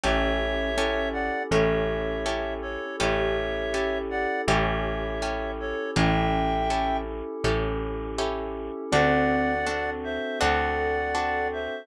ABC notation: X:1
M:4/4
L:1/8
Q:1/4=81
K:A
V:1 name="Clarinet"
[ce]3 [df] [ce]3 [Ac] | [ce]3 [df] [ce]3 [Ac] | [e=g]3 z5 | [df]3 [=ce] [df]3 [ce] |]
V:2 name="Glockenspiel"
C2 C2 C4 | =G8 | C3 z5 | =C2 C2 A4 |]
V:3 name="Acoustic Guitar (steel)"
[CE=GA]2 [CEGA]2 [CEGA]2 [CEGA]2 | [CE=GA]2 [CEGA]2 [CEGA]2 [CEGA]2 | [CE=GA]2 [CEGA]2 [CEGA]2 [CEGA]2 | [=CDFA]2 [CDFA]2 [CDFA]2 [CDFA]2 |]
V:4 name="Electric Bass (finger)" clef=bass
A,,,4 A,,,4 | A,,,4 A,,,4 | A,,,4 A,,,4 | D,,4 D,,4 |]
V:5 name="Pad 5 (bowed)"
[CE=GA]4 [CEGA]4 | [CE=GA]4 [CEGA]4 | [CE=GA]4 [CEGA]4 | [=CDFA]4 [CDFA]4 |]